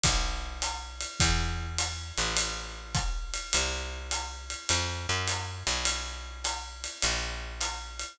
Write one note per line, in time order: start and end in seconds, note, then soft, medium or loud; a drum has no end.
0.03 1.05 B1 medium
0.03 kick medium
0.03 ride loud
0.62 hi-hat pedal loud
0.62 ride medium
1.00 ride medium
1.20 2.12 E2 loud
1.20 kick medium
1.20 ride loud
1.78 hi-hat pedal medium
1.78 ride loud
2.17 3.38 A1 medium
2.17 ride medium
2.37 ride loud
2.95 kick medium
2.95 hi-hat pedal loud
2.95 ride medium
3.34 ride medium
3.53 4.55 C2 medium
3.53 ride loud
4.11 hi-hat pedal medium
4.11 ride loud
4.50 ride medium
4.69 5.07 F2 loud
4.69 ride loud
5.09 5.63 F#2 loud
5.27 hi-hat pedal medium
5.27 ride loud
5.67 6.87 B1 medium
5.67 ride medium
5.85 ride loud
6.44 hi-hat pedal medium
6.44 ride loud
6.84 ride medium
7.02 8.04 A#1 loud
7.02 ride loud
7.60 hi-hat pedal medium
7.60 ride loud
7.99 ride medium